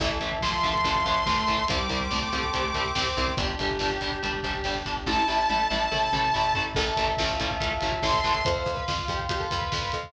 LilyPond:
<<
  \new Staff \with { instrumentName = "Lead 2 (sawtooth)" } { \time 4/4 \key a \minor \tempo 4 = 142 r4 c'''2. | d'''1 | r1 | a''1 |
r2. c'''4 | r1 | }
  \new Staff \with { instrumentName = "Lead 1 (square)" } { \time 4/4 \key a \minor e4 f2 a4 | g4 a2 c'4 | g'1 | e'8 r4. a'8 r4. |
a'4 f'2 r4 | \tuplet 3/2 { c''8 c''8 b'8 } f'8 g'16 r16 g'16 a'16 b'4 r8 | }
  \new Staff \with { instrumentName = "Overdriven Guitar" } { \time 4/4 \key a \minor <e a>8 <e a>8 <e a>8 <e a>8 <e a>8 <e a>8 <e a>8 <e a>8 | <g c'>8 <g c'>8 <g c'>8 <g c'>8 <g c'>8 <g c'>8 <g c'>8 <g c'>8 | <g d'>8 <g d'>8 <g d'>8 <g d'>8 <g d'>8 <g d'>8 <g d'>8 <g d'>8 | <a e'>8 <a e'>8 <a e'>8 <a e'>8 <a e'>8 <a e'>8 <a e'>8 <a e'>8 |
<e a>8 <e a>8 <e a>8 <e a>8 <e a>8 <e a>8 <e a>8 <e a>8 | r1 | }
  \new Staff \with { instrumentName = "Electric Bass (finger)" } { \clef bass \time 4/4 \key a \minor a,,8 a,,8 a,,8 a,,8 a,,8 a,,8 a,,8 a,,8 | c,8 c,8 c,8 c,8 c,8 c,8 c,8 c,8 | g,,8 g,,8 g,,8 g,,8 g,,8 g,,8 g,,8 g,,8 | a,,8 a,,8 a,,8 a,,8 a,,8 a,,8 a,,8 a,,8 |
a,,8 a,,8 a,,8 a,,8 a,,8 a,,8 a,,8 a,,8 | f,8 f,8 f,8 f,8 f,8 f,8 f,8 f,8 | }
  \new Staff \with { instrumentName = "Pad 5 (bowed)" } { \time 4/4 \key a \minor <e'' a''>1 | <g'' c'''>1 | <d' g'>1 | <e' a'>1 |
<e'' a''>1 | <f'' c'''>1 | }
  \new DrumStaff \with { instrumentName = "Drums" } \drummode { \time 4/4 <cymc bd>16 bd16 <hh bd>16 bd16 <bd sn>16 bd16 <hh bd>16 bd16 <hh bd>16 bd16 <hh bd>16 bd16 <bd sn>16 bd16 <hh bd>16 bd16 | <hh bd>16 bd16 <hh bd>16 bd16 <bd sn>16 bd16 <hh bd>16 bd16 <hh bd>16 bd16 <hh bd>16 bd16 <bd sn>16 bd16 <hh bd>16 bd16 | <hh bd>16 bd16 <hh bd>16 bd16 <bd sn>16 bd16 <hh bd>16 bd16 <hh bd>16 bd16 <hh bd>16 bd16 <bd sn>16 bd16 <hh bd>16 bd16 | <bd sn>8 sn8 tommh8 tommh8 toml8 toml8 tomfh8 tomfh8 |
<cymc bd>16 bd16 <hh bd>16 bd16 <bd sn>16 bd16 <hh bd>16 bd16 <hh bd>16 bd16 <hh bd>16 bd16 <bd sn>16 bd16 <hh bd>16 bd16 | <hh bd>16 bd16 <hh bd>16 bd16 <bd sn>16 bd16 <hh bd>16 bd16 <hh bd>16 bd16 <hh bd>16 bd16 <bd sn>16 bd16 <hh bd>16 bd16 | }
>>